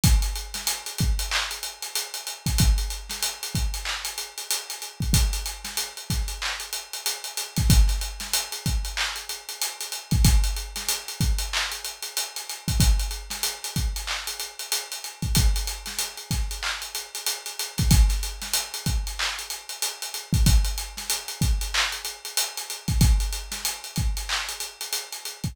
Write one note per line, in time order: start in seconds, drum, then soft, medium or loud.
0.04 kick loud
0.04 closed hi-hat loud
0.22 closed hi-hat medium
0.36 closed hi-hat medium
0.54 snare medium
0.54 closed hi-hat medium
0.67 closed hi-hat loud
0.86 closed hi-hat medium
0.98 kick loud
0.98 closed hi-hat medium
1.19 closed hi-hat medium
1.31 clap loud
1.51 closed hi-hat medium
1.63 closed hi-hat medium
1.82 closed hi-hat medium
1.95 closed hi-hat loud
2.14 closed hi-hat medium
2.27 closed hi-hat medium
2.46 kick medium
2.46 closed hi-hat medium
2.58 kick loud
2.58 closed hi-hat loud
2.78 closed hi-hat medium
2.90 closed hi-hat medium
3.09 snare medium
3.09 closed hi-hat medium
3.22 closed hi-hat loud
3.43 closed hi-hat medium
3.55 kick medium
3.55 closed hi-hat medium
3.74 closed hi-hat medium
3.85 clap loud
4.05 closed hi-hat medium
4.18 closed hi-hat medium
4.38 closed hi-hat medium
4.51 closed hi-hat loud
4.70 closed hi-hat medium
4.82 closed hi-hat medium
5.00 kick medium
5.00 closed hi-hat medium
5.13 kick loud
5.13 closed hi-hat loud
5.33 closed hi-hat medium
5.46 closed hi-hat medium
5.64 snare medium
5.64 closed hi-hat medium
5.77 closed hi-hat loud
5.97 closed hi-hat medium
6.10 kick medium
6.10 snare soft
6.10 closed hi-hat medium
6.28 closed hi-hat medium
6.42 clap loud
6.60 closed hi-hat medium
6.73 closed hi-hat medium
6.93 closed hi-hat medium
7.06 closed hi-hat loud
7.24 closed hi-hat medium
7.37 closed hi-hat loud
7.56 kick loud
7.56 snare soft
7.56 closed hi-hat medium
7.70 kick loud
7.70 closed hi-hat loud
7.88 snare soft
7.88 closed hi-hat medium
8.01 closed hi-hat medium
8.20 snare medium
8.20 closed hi-hat medium
8.33 closed hi-hat loud
8.52 closed hi-hat medium
8.66 kick medium
8.66 closed hi-hat medium
8.85 closed hi-hat medium
8.97 clap loud
9.16 closed hi-hat medium
9.29 closed hi-hat medium
9.49 closed hi-hat medium
9.61 closed hi-hat loud
9.81 closed hi-hat medium
9.92 closed hi-hat medium
10.11 kick loud
10.11 closed hi-hat medium
10.24 kick loud
10.24 closed hi-hat loud
10.44 closed hi-hat medium
10.56 closed hi-hat medium
10.76 snare medium
10.76 closed hi-hat medium
10.88 closed hi-hat loud
11.08 closed hi-hat medium
11.20 kick loud
11.20 closed hi-hat medium
11.38 closed hi-hat medium
11.53 clap loud
11.72 closed hi-hat medium
11.84 closed hi-hat medium
12.02 closed hi-hat medium
12.17 closed hi-hat loud
12.36 closed hi-hat medium
12.49 closed hi-hat medium
12.68 kick medium
12.68 closed hi-hat medium
12.80 kick loud
12.80 closed hi-hat loud
12.99 closed hi-hat medium
13.11 closed hi-hat medium
13.30 snare medium
13.30 closed hi-hat medium
13.43 closed hi-hat loud
13.64 closed hi-hat medium
13.76 kick medium
13.76 closed hi-hat medium
13.96 closed hi-hat medium
14.07 clap loud
14.27 closed hi-hat medium
14.39 closed hi-hat medium
14.59 closed hi-hat medium
14.72 closed hi-hat loud
14.92 closed hi-hat medium
15.04 closed hi-hat medium
15.22 kick medium
15.22 closed hi-hat medium
15.35 kick loud
15.35 closed hi-hat loud
15.56 closed hi-hat medium
15.67 closed hi-hat medium
15.86 snare medium
15.86 closed hi-hat medium
15.99 closed hi-hat loud
16.17 closed hi-hat medium
16.31 kick medium
16.31 snare soft
16.31 closed hi-hat medium
16.51 closed hi-hat medium
16.63 clap loud
16.82 closed hi-hat medium
16.95 closed hi-hat medium
17.15 closed hi-hat medium
17.26 closed hi-hat loud
17.46 closed hi-hat medium
17.59 closed hi-hat loud
17.78 kick loud
17.78 snare soft
17.78 closed hi-hat medium
17.91 kick loud
17.91 closed hi-hat loud
18.09 snare soft
18.09 closed hi-hat medium
18.23 closed hi-hat medium
18.41 snare medium
18.41 closed hi-hat medium
18.53 closed hi-hat loud
18.74 closed hi-hat medium
18.86 kick medium
18.86 closed hi-hat medium
19.07 closed hi-hat medium
19.19 clap loud
19.39 closed hi-hat medium
19.50 closed hi-hat medium
19.69 closed hi-hat medium
19.82 closed hi-hat loud
20.02 closed hi-hat medium
20.14 closed hi-hat medium
20.33 kick loud
20.33 closed hi-hat medium
20.46 kick loud
20.46 closed hi-hat loud
20.64 closed hi-hat medium
20.78 closed hi-hat medium
20.97 snare medium
20.97 closed hi-hat medium
21.10 closed hi-hat loud
21.28 closed hi-hat medium
21.41 kick loud
21.41 closed hi-hat medium
21.61 closed hi-hat medium
21.74 clap loud
21.92 closed hi-hat medium
22.05 closed hi-hat medium
22.25 closed hi-hat medium
22.37 closed hi-hat loud
22.57 closed hi-hat medium
22.70 closed hi-hat medium
22.88 kick medium
22.88 closed hi-hat medium
23.01 kick loud
23.01 closed hi-hat loud
23.20 closed hi-hat medium
23.32 closed hi-hat medium
23.51 snare medium
23.51 closed hi-hat medium
23.65 closed hi-hat loud
23.84 closed hi-hat medium
23.96 kick medium
23.96 closed hi-hat medium
24.17 closed hi-hat medium
24.29 clap loud
24.49 closed hi-hat medium
24.60 closed hi-hat medium
24.81 closed hi-hat medium
24.93 closed hi-hat loud
25.12 closed hi-hat medium
25.25 closed hi-hat medium
25.44 kick medium
25.44 closed hi-hat medium